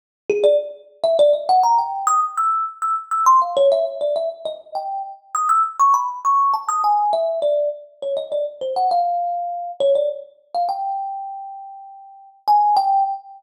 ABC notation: X:1
M:9/8
L:1/16
Q:3/8=67
K:none
V:1 name="Kalimba"
z2 ^G d z3 e d ^d ^f ^a =g2 ^d' z e'2 | z e' z e' c' f ^c e z d e z ^d2 g2 z2 | ^d' e' z ^c' b z c'2 a d' ^g2 e2 =d2 z2 | ^c ^d =d z =c ^f =f6 ^c d z3 f |
g12 ^g2 =g2 z2 |]